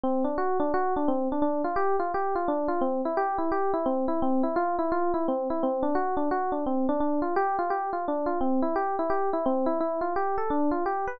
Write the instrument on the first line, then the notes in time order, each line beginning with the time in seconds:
electric piano 1
0.03 C4
0.24 D4
0.38 F#4
0.60 D4
0.74 F#4
0.96 D4
1.08 C4
1.32 D4
1.42 D4
1.64 F4
1.76 G4
1.99 F4
2.14 G4
2.35 F4
2.48 D4
2.68 F4
2.81 C4
3.05 E4
3.17 G4
3.38 E4
3.52 G4
3.74 E4
3.86 C4
4.08 E4
4.22 C4
4.43 E4
4.56 F4
4.79 E4
4.92 F4
5.14 E4
5.28 C4
5.50 E4
5.63 C4
5.83 D4
5.95 F#4
6.17 D4
6.31 F#4
6.52 D4
6.66 C4
6.89 D4
7.00 D4
7.22 F4
7.36 G4
7.59 F4
7.70 G4
7.93 F4
8.08 D4
8.26 F4
8.41 C4
8.62 E4
8.76 G4
8.99 E4
9.10 G4
9.33 E4
9.46 C4
9.66 E4
9.80 E4
10.01 F4
10.16 G4
10.38 A4
10.50 D4
10.71 F4
10.86 G4
11.07 B4